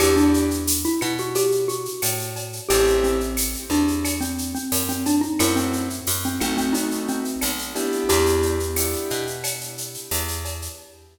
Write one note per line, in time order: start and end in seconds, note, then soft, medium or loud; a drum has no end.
0.00 0.86 E2 medium
0.00 0.47 B3 loud
0.00 0.47 D4 loud
0.00 0.47 E4 loud
0.00 0.16 G4 medium
0.00 0.47 G4 loud
0.00 cowbell loud
0.00 claves loud
0.00 shaker loud
0.16 0.81 D4 medium
0.16 shaker medium
0.34 shaker medium
0.51 shaker medium
0.67 tambourine medium
0.67 shaker loud
0.84 1.01 E4 medium
0.84 shaker medium
1.01 1.88 B2 medium
1.01 1.17 E4 medium
1.01 claves medium
1.01 shaker medium
1.18 1.35 F#4 medium
1.18 shaker medium
1.35 1.63 G4 medium
1.35 cowbell medium
1.35 shaker loud
1.52 shaker medium
1.68 2.53 F#4 medium
1.68 shaker medium
1.85 shaker medium
2.02 2.60 A2 medium
2.02 tambourine medium
2.02 cowbell medium
2.02 claves medium
2.02 shaker loud
2.19 shaker medium
2.36 cowbell medium
2.36 shaker medium
2.53 shaker medium
2.69 3.56 A1 loud
2.69 3.17 A3 loud
2.69 3.17 C4 loud
2.69 3.17 E4 loud
2.69 2.97 G4 medium
2.69 3.17 G4 loud
2.69 cowbell medium
2.69 shaker loud
2.87 shaker medium
3.03 3.66 C4 medium
3.03 shaker medium
3.20 shaker medium
3.37 tambourine medium
3.37 claves medium
3.37 shaker loud
3.54 shaker medium
3.70 4.56 E2 medium
3.70 4.19 D4 medium
3.70 shaker medium
3.88 shaker medium
4.04 cowbell medium
4.04 claves medium
4.04 shaker loud
4.21 4.52 C4 medium
4.21 shaker medium
4.38 shaker medium
4.55 4.83 C4 medium
4.55 shaker medium
4.72 5.29 F#2 medium
4.72 tambourine medium
4.72 cowbell medium
4.72 shaker loud
4.89 5.05 C4 medium
4.89 shaker medium
5.06 5.22 D4 medium
5.06 cowbell medium
5.06 shaker medium
5.21 5.37 D#4 medium
5.21 shaker medium
5.39 6.01 F#2 loud
5.39 5.87 A3 loud
5.39 5.87 C4 loud
5.39 5.87 E4 loud
5.39 5.56 E4 medium
5.39 5.87 F#4 loud
5.39 cowbell medium
5.39 claves loud
5.39 shaker loud
5.56 6.14 C4 medium
5.56 shaker medium
5.73 shaker medium
5.90 shaker medium
6.07 6.39 F#2 medium
6.07 tambourine medium
6.07 shaker loud
6.23 6.41 C4 medium
6.23 shaker medium
6.40 7.36 B1 medium
6.40 7.21 A3 loud
6.40 7.21 B3 loud
6.40 6.57 C4 medium
6.40 7.21 D#4 loud
6.40 7.21 F#4 loud
6.40 claves medium
6.40 shaker medium
6.57 6.74 C4 medium
6.57 shaker medium
6.73 7.03 D#4 medium
6.73 cowbell medium
6.73 shaker medium
6.91 shaker medium
7.08 7.99 C4 medium
7.08 shaker medium
7.25 shaker medium
7.41 8.03 B1 medium
7.41 tambourine medium
7.41 cowbell medium
7.41 claves medium
7.41 shaker medium
7.59 shaker medium
7.75 8.56 B3 loud
7.75 8.56 D4 loud
7.75 8.56 E4 loud
7.75 8.56 G4 loud
7.75 cowbell medium
7.75 shaker medium
7.92 shaker medium
8.09 8.96 E2 loud
8.09 9.37 G4 medium
8.09 cowbell medium
8.09 shaker loud
8.26 shaker medium
8.43 shaker medium
8.60 shaker medium
8.76 9.24 B3 medium
8.76 9.24 D4 medium
8.76 9.24 E4 medium
8.76 9.24 G4 loud
8.76 tambourine medium
8.76 claves medium
8.76 shaker loud
8.93 shaker medium
9.10 9.97 B2 medium
9.10 shaker medium
9.27 shaker medium
9.44 cowbell medium
9.44 claves medium
9.44 shaker loud
9.61 shaker medium
9.78 shaker medium
9.94 shaker medium
10.11 10.69 E2 medium
10.11 tambourine medium
10.11 cowbell medium
10.11 shaker medium
10.28 shaker medium
10.45 cowbell medium
10.45 shaker medium
10.62 shaker medium